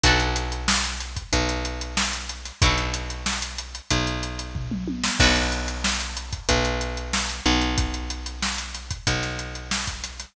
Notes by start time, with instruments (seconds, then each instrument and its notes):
0.03 electric bass (finger) B1, acoustic guitar (steel) D4 F#4 A4 B4, kick, closed hi-hat
0.20 closed hi-hat
0.36 closed hi-hat
0.52 closed hi-hat
0.68 snare
0.84 closed hi-hat
1.00 snare, closed hi-hat
1.17 kick, closed hi-hat
1.33 electric bass (finger) B1, kick, closed hi-hat
1.49 closed hi-hat
1.65 closed hi-hat
1.81 closed hi-hat
1.97 snare
2.13 snare, closed hi-hat
2.29 closed hi-hat
2.45 snare, closed hi-hat
2.62 electric bass (finger) B1, acoustic guitar (steel) D4 F#4 A4, kick, closed hi-hat
2.66 acoustic guitar (steel) B4
2.78 closed hi-hat
2.94 closed hi-hat
3.10 closed hi-hat
3.26 snare
3.42 closed hi-hat
3.58 closed hi-hat
3.75 closed hi-hat
3.91 electric bass (finger) B1, kick, closed hi-hat
4.07 closed hi-hat
4.23 closed hi-hat
4.39 closed hi-hat
4.55 kick, floor tom
4.71 mid tom
4.88 high tom
5.04 snare
5.20 electric bass (finger) B1, acoustic guitar (steel) D4 F#4 A4 B4, kick, crash
5.36 closed hi-hat
5.52 closed hi-hat
5.68 closed hi-hat
5.84 snare
6.00 closed hi-hat
6.17 closed hi-hat
6.33 kick, closed hi-hat
6.49 electric bass (finger) B1, kick, closed hi-hat
6.65 closed hi-hat
6.81 closed hi-hat
6.97 closed hi-hat
7.13 snare
7.29 closed hi-hat
7.46 electric bass (finger) B1, closed hi-hat
7.61 closed hi-hat
7.78 kick, closed hi-hat
7.94 closed hi-hat
8.10 closed hi-hat
8.26 closed hi-hat
8.42 snare
8.58 closed hi-hat
8.75 snare, closed hi-hat
8.91 kick, closed hi-hat
9.07 electric bass (finger) B1, kick, closed hi-hat
9.23 snare, closed hi-hat
9.39 closed hi-hat
9.55 closed hi-hat
9.71 snare
9.87 kick, closed hi-hat
10.03 snare, closed hi-hat
10.20 snare, closed hi-hat